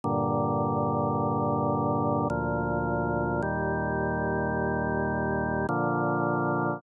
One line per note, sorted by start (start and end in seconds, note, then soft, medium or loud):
0.04 2.28 G2 medium
0.04 2.28 A#2 medium
0.04 2.28 D3 medium
2.30 3.42 D2 medium
2.30 3.42 A#2 medium
2.30 3.42 F3 medium
3.42 5.67 D#2 medium
3.42 5.67 A#2 medium
3.42 5.67 G3 medium
5.69 6.81 A#2 medium
5.69 6.81 D3 medium
5.69 6.81 F3 medium